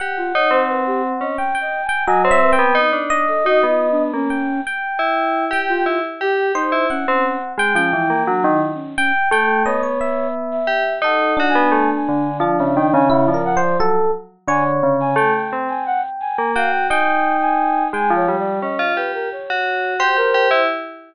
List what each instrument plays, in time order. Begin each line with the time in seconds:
0.00 tubular bells G4, electric piano 1 F#5
0.17 flute F4
0.34 tubular bells D#4, flute C#5
0.51 tubular bells C4, flute C5
0.69 flute B4
0.86 flute G4
1.21 tubular bells C#4, flute D#5
1.38 flute G5, electric piano 1 G5
1.55 electric piano 1 G5
1.61 flute D#5
1.84 flute G#5
1.89 electric piano 1 G5
2.07 tubular bells F#3, electric piano 1 D#5, flute G#5
2.24 tubular bells C4, flute C#5
2.31 electric piano 1 E5
2.42 flute B4
2.53 electric piano 1 G5
2.59 tubular bells B3
2.75 tubular bells D#4
2.93 tubular bells D4
3.10 electric piano 1 D#5
3.28 flute A4
3.44 tubular bells D#4, flute F#4
3.63 tubular bells B3
3.68 flute F4
3.91 flute D4
4.14 tubular bells A#3, flute C#4
4.30 electric piano 1 G5
4.67 electric piano 1 G5
4.99 tubular bells E4
5.51 tubular bells G4, electric piano 1 G5
5.69 flute F4
5.86 tubular bells E4
6.21 tubular bells G4, flute G4
6.55 tubular bells D#4, flute D#4, electric piano 1 C5
6.72 tubular bells E4
6.90 flute C#4, electric piano 1 F#5
7.07 tubular bells C4, flute C#4
7.58 tubular bells G#3, electric piano 1 G5
7.75 tubular bells F3, flute C#4, electric piano 1 G5
7.93 tubular bells E3, flute E4
8.10 tubular bells A#3
8.27 tubular bells F#3, flute D4
8.44 tubular bells D#3
8.51 flute E4
8.74 flute C#4
8.96 flute C#4, electric piano 1 G5
9.31 tubular bells A3, flute A4, electric piano 1 G5
9.65 tubular bells B3, flute C#5, electric piano 1 D#5
9.83 electric piano 1 C#5
10.01 electric piano 1 E5
10.52 flute E5
10.67 tubular bells G4
11.02 tubular bells D#4, electric piano 1 A4, flute F#5
11.37 electric piano 1 D4, tubular bells F#4
11.49 flute G#5
11.55 tubular bells B3
11.72 tubular bells A3
11.96 flute G#5
12.09 tubular bells D3
12.40 tubular bells F3, electric piano 1 D4
12.59 tubular bells C#3, flute E5
12.76 tubular bells D#3, flute G5
12.93 tubular bells C#3, flute G#5
13.10 electric piano 1 E4, flute F#5
13.28 tubular bells F3, flute D5
13.34 electric piano 1 A#4
13.45 flute F#5
13.57 electric piano 1 C5
13.62 flute D5
13.79 tubular bells F#3, electric piano 1 A4
14.48 tubular bells D3, electric piano 1 C#5, flute G#5
14.83 tubular bells C#3
15.00 flute G#5
15.16 tubular bells A3, electric piano 1 G5, flute G#5
15.34 flute G5
15.53 tubular bells C4
15.69 flute G#5
15.86 flute F#5
16.21 flute G#5
16.38 tubular bells A#3
16.56 tubular bells F#4, flute F5, electric piano 1 G5
16.72 flute G5
16.90 tubular bells D#4, electric piano 1 G5, flute G#5
17.41 flute G#5
17.93 tubular bells G#3, electric piano 1 G5, flute G#5
18.10 tubular bells F3
18.16 flute C#5
18.28 tubular bells G3
18.39 flute D5
18.62 tubular bells C#4, flute D#5
18.79 tubular bells F4
18.96 tubular bells G4, flute B4
19.14 flute A#4
19.32 flute C#5
19.50 tubular bells F#4
20.00 tubular bells G4, electric piano 1 C5
20.17 tubular bells G4, flute A#4
20.34 tubular bells G4
20.51 tubular bells E4